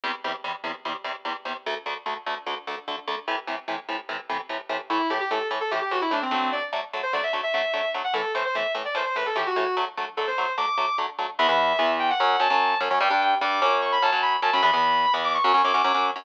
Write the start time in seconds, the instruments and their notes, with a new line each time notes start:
0.04 overdriven guitar E2 C3 G3
0.24 overdriven guitar E2 C3 G3
0.44 overdriven guitar E2 C3 G3
0.64 overdriven guitar E2 C3 G3
0.85 overdriven guitar E2 C3 G3
1.04 overdriven guitar E2 C3 G3
1.25 overdriven guitar E2 C3 G3
1.45 overdriven guitar E2 C3 G3
1.66 overdriven guitar D2 D3 A3
1.86 overdriven guitar D2 D3 A3
2.06 overdriven guitar D2 D3 A3
2.26 overdriven guitar D2 D3 A3
2.46 overdriven guitar D2 D3 A3
2.67 overdriven guitar D2 D3 A3
2.88 overdriven guitar D2 D3 A3
3.07 overdriven guitar D2 D3 A3
3.28 overdriven guitar A2 C3 E3
3.47 overdriven guitar A2 C3 E3
3.68 overdriven guitar A2 C3 E3
3.89 overdriven guitar A2 C3 E3
4.09 overdriven guitar A2 C3 E3
4.29 overdriven guitar A2 C3 E3
4.49 overdriven guitar A2 C3 E3
4.69 overdriven guitar A2 C3 E3
4.90 overdriven guitar A2 E3 A3, distortion guitar E4
5.10 overdriven guitar A2 E3 A3, distortion guitar G4
5.20 distortion guitar G4
5.30 overdriven guitar A2 E3 A3, distortion guitar A4
5.51 overdriven guitar A2 E3 A3
5.61 distortion guitar A4
5.71 overdriven guitar A2 E3 A3, distortion guitar G4
5.81 distortion guitar G4
5.91 overdriven guitar A2 E3 A3, distortion guitar F#4
6.01 distortion guitar E4
6.11 overdriven guitar A2 E3 A3, distortion guitar D4
6.22 distortion guitar C4
6.31 overdriven guitar D3 F#3 A3, distortion guitar C4
6.52 distortion guitar D5
6.73 overdriven guitar D3 F#3 A3
6.93 overdriven guitar D3 F#3 A3
7.03 distortion guitar C5
7.13 overdriven guitar D3 F#3 A3, distortion guitar D5
7.23 distortion guitar E5
7.33 overdriven guitar D3 F#3 A3
7.43 distortion guitar E5
7.54 overdriven guitar D3 F#3 A3, distortion guitar E5
7.74 overdriven guitar D3 F#3 A3
7.94 overdriven guitar D3 F#3 A3
8.04 distortion guitar F#5
8.14 overdriven guitar A2 E3 A3, distortion guitar A4
8.35 overdriven guitar A2 E3 A3, distortion guitar C5
8.45 distortion guitar C5
8.55 overdriven guitar A2 E3 A3, distortion guitar E5
8.75 overdriven guitar A2 E3 A3
8.85 distortion guitar D5
8.95 overdriven guitar A2 E3 A3, distortion guitar C5
9.05 distortion guitar C5
9.16 overdriven guitar A2 E3 A3, distortion guitar B4
9.26 distortion guitar A4
9.36 overdriven guitar A2 E3 A3, distortion guitar G4
9.46 distortion guitar F#4
9.56 overdriven guitar A2 E3 A3, distortion guitar F#4
9.77 overdriven guitar D3 F#3 A3
9.97 overdriven guitar D3 F#3 A3
10.17 overdriven guitar D3 F#3 A3, distortion guitar A4
10.27 distortion guitar C5
10.38 overdriven guitar D3 F#3 A3
10.57 overdriven guitar D3 F#3 A3, distortion guitar D6
10.78 overdriven guitar D3 F#3 A3
10.98 overdriven guitar D3 F#3 A3
11.19 overdriven guitar D3 F#3 A3
11.39 overdriven guitar E2 E3 B3, distortion guitar E5
11.49 overdriven guitar E2 E3 B3
11.79 overdriven guitar E2 E3 B3
11.99 distortion guitar G5
12.10 distortion guitar F#5
12.20 overdriven guitar F#2 F#3 C#4
12.40 overdriven guitar F#2 F#3 C#4, distortion guitar A5
12.50 overdriven guitar F#2 F#3 C#4
12.80 overdriven guitar F#2 F#3 C#4
12.91 overdriven guitar F#2 F#3 C#4
13.00 overdriven guitar G2 G3 D4, distortion guitar G5
13.10 overdriven guitar G2 G3 D4
13.21 distortion guitar G5
13.41 overdriven guitar G2 G3 D4, distortion guitar D6
13.62 overdriven guitar F#2 F#3 C#4, distortion guitar D6
13.82 distortion guitar C#6
13.92 distortion guitar B5
14.02 overdriven guitar F#2 F#3 C#4, distortion guitar A5
14.12 overdriven guitar F#2 F#3 C#4
14.22 distortion guitar B5
14.42 overdriven guitar F#2 F#3 C#4, distortion guitar A5
14.53 overdriven guitar F#2 F#3 C#4, distortion guitar B5
14.63 overdriven guitar E2 E3 B3, distortion guitar B5
14.73 overdriven guitar E2 E3 B3
15.14 overdriven guitar E2 E3 B3
15.24 distortion guitar D6
15.34 distortion guitar C#6
15.44 overdriven guitar F#2 F#3 C#4
15.54 overdriven guitar F#2 F#3 C#4
15.64 overdriven guitar F#2 F#3 C#4, distortion guitar D6
15.74 overdriven guitar F#2 F#3 C#4
15.84 overdriven guitar F#2 F#3 C#4
15.94 overdriven guitar F#2 F#3 C#4
16.16 overdriven guitar F#2 F#3 C#4